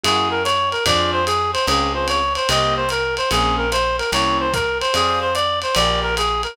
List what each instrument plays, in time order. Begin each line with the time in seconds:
0.03 electric bass (finger) F#2, acoustic grand piano A#3 E4 F#4 G#4, clarinet G#4, ride
0.31 clarinet A#4
0.44 clarinet C#5, hi-hat pedal, ride
0.72 clarinet A#4, ride
0.86 electric bass (finger) F2, acoustic grand piano C4 D4 F4 G#4, clarinet D5, kick, ride
1.12 clarinet C5
1.26 clarinet G#4, hi-hat pedal, ride
1.53 clarinet C5, ride
1.67 electric bass (finger) C#2, acoustic grand piano C4 C#4 F4 G#4, clarinet G#4, ride
1.94 acoustic grand piano C4 C#4 F4 G#4, clarinet C5
2.08 clarinet C#5, hi-hat pedal, ride
2.35 clarinet C5, ride
2.49 electric bass (finger) C2, acoustic grand piano A#3 C4 D#4 G4, clarinet D#5, ride
2.76 clarinet C5
2.89 clarinet A#4, hi-hat pedal, ride
3.17 clarinet C5, ride
3.31 electric bass (finger) A#1, acoustic grand piano A#3 C4 C#4 G#4, clarinet G#4, ride
3.58 clarinet A#4
3.72 clarinet C5, hi-hat pedal, ride
3.98 clarinet A#4, ride
4.12 electric bass (finger) C2, acoustic grand piano A#3 C4 C#4 E4, clarinet C#5, ride
4.40 clarinet C5
4.53 clarinet A#4, kick, hi-hat pedal, ride
4.81 clarinet C5, ride
4.94 electric bass (finger) F2, acoustic grand piano G#4 C5 D5 F5, clarinet G#4, ride
5.21 clarinet C5
5.35 clarinet D5, hi-hat pedal, ride
5.62 clarinet C5, ride
5.75 electric bass (finger) A#1, acoustic grand piano G4 G#4 A#4 D5, clarinet D5, ride
6.02 clarinet A#4
6.17 clarinet G#4, hi-hat pedal, ride
6.43 clarinet A#4, ride